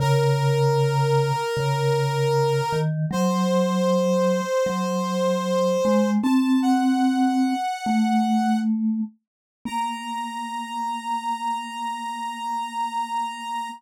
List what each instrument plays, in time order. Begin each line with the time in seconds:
0.00 vibraphone C#3, clarinet A#4
1.57 vibraphone C#3
2.72 vibraphone D#3
3.11 vibraphone F#3, clarinet C5
4.66 vibraphone F#3
5.85 vibraphone G#3
6.23 vibraphone C4, clarinet A5
6.62 clarinet F#5
7.86 vibraphone A3
9.65 vibraphone A#3, clarinet A#5